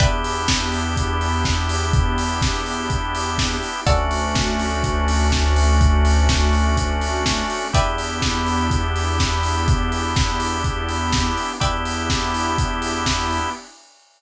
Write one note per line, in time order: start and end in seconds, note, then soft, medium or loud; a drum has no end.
0.00 3.56 E2 loud
0.00 3.84 B3 medium
0.00 3.81 B3 medium
0.00 3.84 D4 medium
0.00 3.81 D4 medium
0.00 3.84 E4 medium
0.00 3.81 E4 medium
0.00 3.84 G4 medium
0.00 3.81 G4 medium
0.00 3.79 B4 medium
0.00 3.79 D5 medium
0.00 3.79 E5 medium
0.00 3.79 G5 medium
0.00 kick loud
0.00 closed hi-hat loud
0.24 open hi-hat medium
0.48 kick medium
0.48 snare loud
0.72 open hi-hat medium
0.97 kick medium
0.97 closed hi-hat loud
1.21 open hi-hat medium
1.45 kick medium
1.45 snare loud
1.69 open hi-hat medium
1.93 kick loud
1.93 closed hi-hat medium
2.18 open hi-hat medium
2.42 kick loud
2.42 snare loud
2.66 open hi-hat medium
2.90 kick medium
2.90 closed hi-hat loud
3.15 open hi-hat medium
3.38 kick medium
3.38 snare loud
3.63 open hi-hat medium
3.86 7.42 D2 loud
3.86 7.70 A3 medium
3.86 7.68 A3 medium
3.86 7.70 C#4 medium
3.86 7.68 C#4 medium
3.86 7.70 D4 medium
3.86 7.68 D4 medium
3.86 7.70 F#4 medium
3.86 7.68 F#4 medium
3.86 7.66 A4 medium
3.86 7.66 C#5 medium
3.86 7.66 D5 medium
3.86 7.66 F#5 medium
3.86 kick loud
3.86 closed hi-hat loud
4.11 open hi-hat medium
4.35 kick medium
4.35 snare loud
4.60 open hi-hat medium
4.84 kick medium
4.84 closed hi-hat loud
5.08 open hi-hat medium
5.32 kick medium
5.32 snare loud
5.56 open hi-hat medium
5.81 kick loud
5.81 closed hi-hat loud
6.05 open hi-hat medium
6.29 kick medium
6.29 snare loud
6.53 open hi-hat medium
6.77 kick medium
6.77 closed hi-hat loud
7.01 open hi-hat medium
7.26 kick medium
7.26 snare loud
7.50 open hi-hat medium
7.73 11.31 E2 loud
7.73 11.53 B3 medium
7.73 11.58 B3 medium
7.73 11.53 D4 medium
7.73 11.58 D4 medium
7.73 11.53 E4 medium
7.73 11.58 E4 medium
7.73 11.53 G4 medium
7.73 11.58 G4 medium
7.73 11.54 B4 medium
7.73 11.54 D5 medium
7.73 11.54 E5 medium
7.73 11.54 G5 medium
7.73 kick loud
7.73 closed hi-hat loud
7.98 open hi-hat medium
8.22 kick medium
8.22 snare loud
8.47 open hi-hat medium
8.71 kick medium
8.71 closed hi-hat loud
8.96 open hi-hat medium
9.19 kick medium
9.19 snare loud
9.43 open hi-hat medium
9.68 kick loud
9.68 closed hi-hat loud
9.92 open hi-hat medium
10.16 kick loud
10.16 snare loud
10.40 open hi-hat medium
10.64 kick medium
10.64 closed hi-hat medium
10.89 open hi-hat medium
11.13 kick medium
11.13 snare loud
11.37 open hi-hat medium
11.60 13.40 E2 medium
11.60 13.50 B3 medium
11.60 13.53 B3 medium
11.60 13.50 D4 medium
11.60 13.53 D4 medium
11.60 13.50 E4 medium
11.60 13.53 E4 medium
11.60 13.50 G4 medium
11.60 13.53 G4 medium
11.60 13.51 B4 medium
11.60 13.51 D5 medium
11.60 13.51 E5 medium
11.60 13.51 G5 medium
11.60 kick medium
11.60 closed hi-hat loud
11.85 open hi-hat medium
12.10 kick medium
12.10 snare loud
12.34 open hi-hat medium
12.58 kick loud
12.58 closed hi-hat loud
12.82 open hi-hat medium
13.06 kick medium
13.06 snare loud
13.31 open hi-hat medium